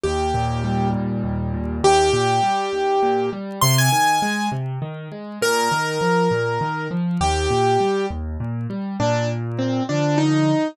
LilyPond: <<
  \new Staff \with { instrumentName = "Acoustic Grand Piano" } { \time 6/8 \key ees \major \tempo 4. = 67 g'4. r4. | g'2. | c'''16 aes''4~ aes''16 r4. | bes'2. |
g'4. r4. | \key bes \major d'8 r8 c'8 d'8 ees'4 | }
  \new Staff \with { instrumentName = "Acoustic Grand Piano" } { \clef bass \time 6/8 \key ees \major ees,8 bes,8 g8 bes,8 ees,8 bes,8 | ees,8 bes,8 g8 ees,8 bes,8 g8 | c8 ees8 aes8 c8 ees8 aes8 | bes,8 ees8 f8 bes,8 ees8 f8 |
ees,8 bes,8 g8 ees,8 bes,8 g8 | \key bes \major bes,4. <d f>4. | }
>>